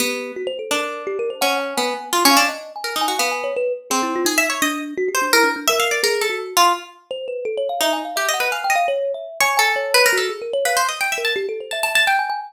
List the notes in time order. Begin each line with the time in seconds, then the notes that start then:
0.00 B3 G4
0.36 F#4
0.47 C5
0.59 A4
0.71 D4 A#4
1.07 G4
1.19 A#4
1.30 C5
1.41 C#4 F#5
1.60 G#5
1.77 B3 G#5
2.13 F4
2.25 C#4
2.31 F5
2.37 D4
2.48 D#5
2.76 G#5
2.84 A#4
2.96 D#4
3.01 G#5
3.08 F#4
3.19 B3 F5
3.31 G#5
3.44 C#5
3.56 B4
3.90 C4 G#4
4.03 E4
4.16 F4
4.25 D#4 G#4
4.38 E5
4.50 C#5
4.62 D4 D#5
4.97 F#4
5.08 G4
5.15 C5
5.22 D4
5.33 E4 A#4
5.44 D4
5.56 D4
5.68 A#4 E5
5.80 F5
5.91 D5
6.03 G#4 A#4
6.21 A4
6.30 F#4
6.57 F4
7.11 C5
7.28 B4
7.45 A4
7.57 C#5
7.69 F5
7.81 D#4 E5
7.93 G#5
8.05 F5
8.16 G4 E5
8.29 D#5
8.34 F#5
8.40 B4
8.52 F5 G#5
8.64 G5
8.70 D#5
8.76 F5
8.88 C#5
9.14 E5
9.40 C#5 G#5
9.57 A4 G#5
9.76 C#5
9.94 B4
10.06 A#4
10.13 F#4
10.17 A4
10.29 G#4
10.42 A#4
10.53 C#5
10.65 B4 F5
10.77 C5
10.89 D#5
11.01 G5
11.12 E5
11.18 A#4
11.25 A5
11.36 G4
11.49 A4
11.60 C5
11.71 E5 A5
11.83 A5
11.95 A5
12.07 G5
12.19 G#5
12.30 G#5